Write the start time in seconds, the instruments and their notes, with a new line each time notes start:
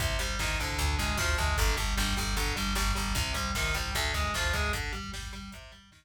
0.00 electric bass (finger) C2, overdriven guitar C3, kick, closed hi-hat
0.10 kick
0.19 electric bass (finger) C2, overdriven guitar G3, kick, closed hi-hat
0.29 kick
0.39 electric bass (finger) C2, overdriven guitar D#3, kick, snare
0.50 kick
0.59 electric bass (finger) C2, overdriven guitar D3, kick, snare, closed hi-hat
0.69 kick
0.79 electric bass (finger) D2, kick, closed hi-hat
0.89 kick
0.99 electric bass (finger) D2, overdriven guitar G#3, kick, closed hi-hat
1.09 kick
1.17 electric bass (finger) D2, overdriven guitar F3, kick, snare
1.28 kick
1.38 electric bass (finger) D2, overdriven guitar G#3, kick, closed hi-hat
1.47 kick
1.57 electric bass (finger) G1, overdriven guitar D3, kick, closed hi-hat
1.68 kick
1.77 electric bass (finger) G1, overdriven guitar G3, kick, closed hi-hat
1.88 kick
1.97 electric bass (finger) G1, overdriven guitar G3, kick, snare
2.08 kick
2.17 electric bass (finger) G1, overdriven guitar G3, kick, snare, closed hi-hat
2.27 kick
2.37 electric bass (finger) G1, overdriven guitar D3, kick, closed hi-hat
2.47 kick
2.56 electric bass (finger) G1, overdriven guitar G3, kick, closed hi-hat
2.67 kick
2.75 electric bass (finger) G1, overdriven guitar G3, kick, snare
2.87 kick
2.95 electric bass (finger) G1, overdriven guitar G3, kick, closed hi-hat
3.06 kick
3.15 electric bass (finger) C2, overdriven guitar C3, kick, closed hi-hat
3.25 kick
3.34 electric bass (finger) C2, overdriven guitar G3, kick, closed hi-hat
3.45 kick
3.54 electric bass (finger) C2, overdriven guitar D#3, kick, snare
3.65 kick
3.74 electric bass (finger) C2, overdriven guitar G3, kick, snare, closed hi-hat
3.85 kick
3.95 electric bass (finger) D2, overdriven guitar D3, kick, closed hi-hat
4.05 kick
4.14 electric bass (finger) D2, overdriven guitar G#3, kick, closed hi-hat
4.24 kick
4.34 electric bass (finger) D2, overdriven guitar F3, kick, snare
4.44 kick
4.53 electric bass (finger) D2, overdriven guitar G#3, kick, closed hi-hat
4.64 kick
4.73 overdriven guitar D3, kick, closed hi-hat
4.83 kick
4.93 overdriven guitar G3, kick, closed hi-hat
5.04 kick
5.13 overdriven guitar G3, kick, snare
5.22 kick
5.33 overdriven guitar G3, kick, snare, closed hi-hat
5.42 kick
5.52 overdriven guitar C3, kick, closed hi-hat
5.62 kick
5.72 overdriven guitar G3, kick, closed hi-hat
5.83 kick
5.92 overdriven guitar D#3, kick, snare
6.02 kick